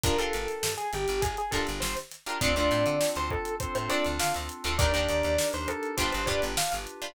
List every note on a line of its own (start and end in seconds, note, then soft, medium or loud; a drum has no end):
0.03 0.18 G1 loud
0.03 0.15 D4 medium
0.03 0.15 F4 medium
0.03 0.15 G4 medium
0.03 0.18 A#4 medium
0.03 0.15 A#4 medium
0.03 kick loud
0.03 closed hi-hat loud
0.18 0.66 D4 medium
0.18 0.66 F4 medium
0.18 0.66 G4 medium
0.18 0.74 A4 medium
0.18 0.66 A#4 medium
0.18 closed hi-hat medium
0.33 0.47 G1 medium
0.33 closed hi-hat medium
0.48 snare soft
0.48 closed hi-hat medium
0.63 0.76 G2 medium
0.63 snare loud
0.77 0.91 G#4 medium
0.77 snare soft
0.77 closed hi-hat medium
0.93 1.07 G1 medium
0.93 1.21 G4 medium
0.93 closed hi-hat medium
1.08 1.22 G1 loud
1.08 closed hi-hat medium
1.22 1.36 G1 medium
1.22 1.36 G#4 medium
1.22 kick loud
1.22 closed hi-hat loud
1.37 1.52 G#4 medium
1.37 snare soft
1.37 closed hi-hat medium
1.51 1.66 G1 medium
1.51 2.00 D4 medium
1.51 2.00 F4 medium
1.51 2.00 G4 medium
1.51 1.65 A4 medium
1.51 2.00 A#4 medium
1.51 kick medium
1.51 closed hi-hat medium
1.67 1.82 G1 medium
1.67 closed hi-hat medium
1.80 1.96 G1 medium
1.80 1.94 C5 medium
1.80 snare loud
1.97 snare medium
1.97 closed hi-hat medium
2.11 snare soft
2.11 closed hi-hat medium
2.26 2.38 D4 medium
2.26 2.38 F4 medium
2.26 2.38 G4 medium
2.26 2.38 A#4 medium
2.26 closed hi-hat medium
2.41 2.55 D2 loud
2.41 2.53 C4 medium
2.41 2.95 C4 loud
2.41 2.53 D4 medium
2.41 2.95 D4 loud
2.41 2.95 F4 loud
2.41 2.53 F4 medium
2.41 2.95 A4 loud
2.41 2.53 A4 medium
2.41 2.55 D5 medium
2.41 kick loud
2.41 closed hi-hat loud
2.56 2.70 D2 medium
2.56 3.04 C4 medium
2.56 3.04 D4 medium
2.56 3.04 F4 medium
2.56 3.04 A4 medium
2.56 3.10 D5 medium
2.56 closed hi-hat medium
2.71 2.85 A2 loud
2.71 snare soft
2.71 closed hi-hat medium
2.86 3.00 D3 loud
2.86 closed hi-hat medium
3.00 3.53 C4 medium
3.00 3.53 D4 loud
3.00 3.53 F4 loud
3.00 3.53 A4 loud
3.00 snare loud
3.15 3.29 D2 medium
3.15 3.31 C5 medium
3.15 closed hi-hat medium
3.30 3.55 A4 medium
3.30 kick medium
3.45 closed hi-hat medium
3.60 4.14 C4 loud
3.60 4.14 D4 medium
3.60 4.14 F4 medium
3.60 4.14 A4 loud
3.60 3.74 C5 medium
3.60 kick medium
3.60 closed hi-hat loud
3.75 3.89 A2 medium
3.75 3.89 C5 medium
3.75 closed hi-hat medium
3.89 4.37 C4 medium
3.89 4.37 D4 medium
3.89 4.37 F4 medium
3.89 4.37 A4 medium
3.89 4.03 D5 medium
3.89 snare soft
3.89 closed hi-hat medium
4.05 4.19 D2 medium
4.05 closed hi-hat medium
4.19 4.33 D3 loud
4.19 4.72 C4 loud
4.19 4.72 D4 medium
4.19 4.72 F4 loud
4.19 4.72 A4 medium
4.19 4.34 F5 medium
4.19 snare loud
4.34 4.49 D2 medium
4.34 snare medium
4.34 closed hi-hat medium
4.49 closed hi-hat medium
4.64 4.78 D2 loud
4.64 4.76 C4 medium
4.64 4.76 D4 medium
4.64 4.76 F4 medium
4.64 4.76 A4 medium
4.64 closed hi-hat medium
4.78 4.93 D#2 loud
4.78 4.91 D4 medium
4.78 5.32 D4 loud
4.78 5.32 D#4 loud
4.78 4.91 D#4 medium
4.78 5.32 G4 loud
4.78 4.91 G4 medium
4.78 5.32 A#4 loud
4.78 4.91 A#4 medium
4.78 4.92 D5 medium
4.78 kick loud
4.78 closed hi-hat loud
4.94 5.08 D#2 medium
4.94 5.41 D4 medium
4.94 5.41 D#4 medium
4.94 5.41 G4 medium
4.94 5.41 A#4 medium
4.94 5.47 D5 medium
4.94 closed hi-hat medium
5.09 5.23 D#2 loud
5.09 closed hi-hat medium
5.23 5.38 D#2 loud
5.23 closed hi-hat medium
5.38 5.92 D4 medium
5.38 5.92 D#4 loud
5.38 5.92 G4 medium
5.38 5.92 A#4 loud
5.38 snare loud
5.53 5.67 D#2 medium
5.53 5.68 C5 medium
5.53 snare soft
5.53 closed hi-hat medium
5.68 5.95 A4 medium
5.68 closed hi-hat medium
5.83 closed hi-hat medium
5.97 6.12 G1 loud
5.97 6.21 D4 medium
5.97 6.52 D4 loud
5.97 6.21 F4 medium
5.97 6.52 F4 loud
5.97 6.52 G4 loud
5.97 6.21 G4 medium
5.97 6.52 B4 loud
5.97 6.21 B4 medium
5.97 6.11 C5 medium
5.97 kick medium
5.97 closed hi-hat loud
6.12 6.28 G1 loud
6.12 6.26 C5 medium
6.12 closed hi-hat medium
6.26 6.41 G2 medium
6.26 6.75 D4 medium
6.26 6.75 F4 medium
6.26 6.75 G4 medium
6.26 6.75 B4 medium
6.26 6.40 D5 medium
6.26 kick medium
6.26 closed hi-hat medium
6.42 6.56 G1 loud
6.42 closed hi-hat medium
6.57 7.10 D4 medium
6.57 7.10 F4 medium
6.57 7.10 G4 medium
6.57 7.10 B4 medium
6.57 6.72 F5 medium
6.57 snare loud
6.72 6.87 G1 medium
6.72 snare medium
6.72 closed hi-hat medium
6.87 closed hi-hat medium
7.02 7.13 D4 medium
7.02 7.13 F4 medium
7.02 7.13 G4 medium
7.02 7.13 B4 medium
7.02 closed hi-hat medium